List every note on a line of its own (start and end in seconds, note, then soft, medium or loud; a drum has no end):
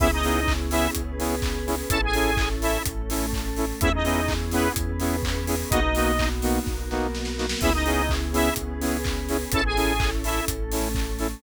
0.00 0.88 C#2 medium
0.00 0.08 B3 medium
0.00 0.95 B3 medium
0.00 0.08 C#4 medium
0.00 0.95 C#4 medium
0.00 0.08 E4 medium
0.00 0.11 E4 loud
0.00 0.95 E4 medium
0.00 0.08 G#4 medium
0.00 0.95 G#4 medium
0.00 0.11 E5 loud
0.00 kick loud
0.00 crash loud
0.13 0.53 D#4 loud
0.13 0.53 D#5 loud
0.23 0.40 B3 medium
0.23 0.40 C#4 medium
0.23 0.40 E4 medium
0.23 0.40 G#4 medium
0.23 open hi-hat medium
0.47 kick loud
0.47 clap loud
0.71 0.88 B3 medium
0.71 0.88 C#4 medium
0.71 0.90 E4 medium
0.71 0.88 E4 medium
0.71 0.88 G#4 medium
0.71 0.90 E5 loud
0.71 open hi-hat loud
0.95 1.83 C#2 medium
0.95 1.90 B3 medium
0.95 1.89 C#4 medium
0.95 1.90 G#4 medium
0.95 1.90 B4 medium
0.95 kick medium
0.95 closed hi-hat loud
1.19 1.36 B3 medium
1.19 1.36 C#4 medium
1.19 1.36 E4 medium
1.19 1.36 G#4 medium
1.19 open hi-hat medium
1.42 kick loud
1.42 clap loud
1.67 1.75 B3 medium
1.67 1.75 C#4 medium
1.67 1.75 E4 medium
1.67 1.75 G#4 medium
1.67 open hi-hat medium
1.90 2.78 A1 medium
1.90 2.84 C#4 medium
1.90 1.99 C#4 medium
1.90 2.84 E4 medium
1.90 1.99 E4 medium
1.90 2.84 A4 medium
1.90 2.01 A4 loud
1.90 1.99 A4 medium
1.90 2.01 A5 loud
1.90 kick loud
1.90 closed hi-hat loud
2.04 2.49 G#4 medium
2.04 2.49 G#5 loud
2.13 2.31 C#4 medium
2.13 2.31 E4 medium
2.13 2.31 A4 medium
2.13 open hi-hat medium
2.37 kick loud
2.37 clap loud
2.62 2.78 C#4 medium
2.62 2.78 E4 medium
2.62 2.83 E4 medium
2.62 2.78 A4 medium
2.62 2.83 E5 medium
2.62 open hi-hat loud
2.86 3.73 A1 medium
2.86 3.81 A3 medium
2.86 3.81 C#4 medium
2.86 3.81 A4 medium
2.86 kick loud
2.86 closed hi-hat loud
3.10 3.26 C#4 medium
3.10 3.26 E4 medium
3.10 3.26 A4 medium
3.10 open hi-hat loud
3.33 kick loud
3.33 clap loud
3.57 3.65 C#4 medium
3.57 3.65 E4 medium
3.57 3.65 A4 medium
3.57 open hi-hat medium
3.81 4.69 E2 medium
3.81 3.90 B3 medium
3.81 4.75 B3 medium
3.81 3.90 C#4 medium
3.81 4.75 C#4 medium
3.81 3.92 E4 loud
3.81 3.90 E4 medium
3.81 4.77 E4 medium
3.81 3.90 G#4 medium
3.81 4.75 G#4 medium
3.81 3.92 E5 loud
3.81 kick loud
3.81 closed hi-hat loud
3.94 4.33 D#4 medium
3.94 4.33 D#5 medium
4.04 4.21 B3 medium
4.04 4.21 C#4 medium
4.04 4.21 E4 medium
4.04 4.21 G#4 medium
4.04 open hi-hat medium
4.28 kick loud
4.28 clap loud
4.51 4.69 B3 medium
4.51 4.73 B3 medium
4.51 4.69 C#4 medium
4.51 4.69 E4 medium
4.51 4.69 G#4 medium
4.51 4.73 B4 loud
4.51 open hi-hat loud
4.75 5.64 E2 medium
4.75 5.70 B3 medium
4.75 5.70 C#4 medium
4.75 5.70 G#4 medium
4.75 5.70 B4 medium
4.75 kick loud
4.75 closed hi-hat loud
5.00 5.16 B3 medium
5.00 5.16 C#4 medium
5.00 5.16 E4 medium
5.00 5.16 G#4 medium
5.00 open hi-hat medium
5.23 kick loud
5.23 clap loud
5.47 5.55 B3 medium
5.47 5.55 C#4 medium
5.47 5.55 E4 medium
5.47 5.55 G#4 medium
5.47 open hi-hat loud
5.70 6.59 B1 medium
5.70 5.80 A#3 medium
5.70 6.66 A#3 medium
5.70 5.80 B3 medium
5.70 6.66 B3 medium
5.70 6.29 D#4 loud
5.70 5.80 D#4 loud
5.70 6.67 D#4 medium
5.70 5.80 F#4 medium
5.70 6.66 F#4 medium
5.70 6.29 D#5 loud
5.70 kick loud
5.70 closed hi-hat loud
5.95 6.12 A#3 medium
5.95 6.12 B3 medium
5.95 6.12 D#4 medium
5.95 6.12 F#4 medium
5.95 open hi-hat medium
6.19 kick medium
6.19 clap loud
6.42 6.59 A#3 medium
6.42 6.59 B3 medium
6.42 6.59 D#4 medium
6.42 6.59 F#4 medium
6.42 open hi-hat loud
6.66 7.54 B1 medium
6.66 7.61 A#3 medium
6.66 7.61 B3 medium
6.66 7.61 F#4 medium
6.66 7.61 A#4 medium
6.66 kick loud
6.66 snare medium
6.91 7.07 A#3 medium
6.91 7.07 B3 medium
6.91 7.07 D#4 medium
6.91 7.07 F#4 medium
6.91 snare medium
7.15 snare medium
7.25 snare medium
7.38 7.46 A#3 medium
7.38 7.46 B3 medium
7.38 7.46 D#4 medium
7.38 7.46 F#4 medium
7.38 snare loud
7.49 snare loud
7.61 8.50 C#2 medium
7.61 7.70 B3 medium
7.61 8.57 B3 medium
7.61 7.70 C#4 medium
7.61 8.57 C#4 medium
7.61 7.73 E4 loud
7.61 7.70 E4 medium
7.61 8.57 E4 medium
7.61 7.70 G#4 medium
7.61 8.57 G#4 medium
7.61 7.73 E5 loud
7.61 kick loud
7.61 crash loud
7.74 8.14 D#4 loud
7.74 8.14 D#5 loud
7.86 8.02 B3 medium
7.86 8.02 C#4 medium
7.86 8.02 E4 medium
7.86 8.02 G#4 medium
7.86 open hi-hat medium
8.09 kick loud
8.09 clap loud
8.33 8.50 B3 medium
8.33 8.50 C#4 medium
8.33 8.50 E4 medium
8.33 8.54 E4 medium
8.33 8.50 G#4 medium
8.33 8.54 E5 loud
8.33 open hi-hat loud
8.56 9.45 C#2 medium
8.56 9.53 B3 medium
8.56 9.51 C#4 medium
8.56 9.53 G#4 medium
8.56 9.53 B4 medium
8.56 kick medium
8.56 closed hi-hat loud
8.81 8.97 B3 medium
8.81 8.97 C#4 medium
8.81 8.97 E4 medium
8.81 8.97 G#4 medium
8.81 open hi-hat medium
9.04 kick loud
9.04 clap loud
9.29 9.37 B3 medium
9.29 9.37 C#4 medium
9.29 9.37 E4 medium
9.29 9.37 G#4 medium
9.29 open hi-hat medium
9.52 10.40 A1 medium
9.52 10.46 C#4 medium
9.52 9.61 C#4 medium
9.52 10.46 E4 medium
9.52 9.61 E4 medium
9.52 10.46 A4 medium
9.52 9.64 A4 loud
9.52 9.61 A4 medium
9.52 9.64 A5 loud
9.52 kick loud
9.52 closed hi-hat loud
9.65 10.10 G#4 medium
9.65 10.10 G#5 loud
9.76 9.93 C#4 medium
9.76 9.93 E4 medium
9.76 9.93 A4 medium
9.76 open hi-hat medium
10.00 kick loud
10.00 clap loud
10.24 10.41 C#4 medium
10.24 10.41 E4 medium
10.24 10.45 E4 medium
10.24 10.41 A4 medium
10.24 10.45 E5 medium
10.24 open hi-hat loud
10.48 11.35 A1 medium
10.48 11.42 A3 medium
10.48 11.42 C#4 medium
10.48 11.42 A4 medium
10.48 kick loud
10.48 closed hi-hat loud
10.72 10.88 C#4 medium
10.72 10.88 E4 medium
10.72 10.88 A4 medium
10.72 open hi-hat loud
10.95 kick loud
10.95 clap loud
11.19 11.27 C#4 medium
11.19 11.27 E4 medium
11.19 11.27 A4 medium
11.19 open hi-hat medium